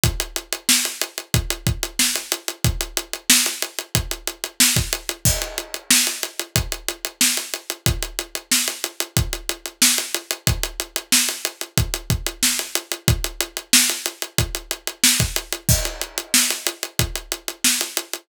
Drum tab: CC |----------------|----------------|x---------------|----------------|
HH |xxxx-xxxxxxx-xxx|xxxx-xxxxxxx-xxx|-xxx-xxxxxxx-xxx|xxxx-xxxxxxx-xxx|
SD |----o-------o---|----o-------o---|----o-------o---|----o-------o---|
BD |o-------o-o-----|o-------o----o--|o-------o-------|o-------o-------|

CC |----------------|----------------|x---------------|
HH |xxxx-xxxxxxx-xxx|xxxx-xxxxxxx-xxx|-xxx-xxxxxxx-xxx|
SD |----o-------o---|----o-------o---|----o-------o---|
BD |o-------o-o-----|o-------o----o--|o-------o-------|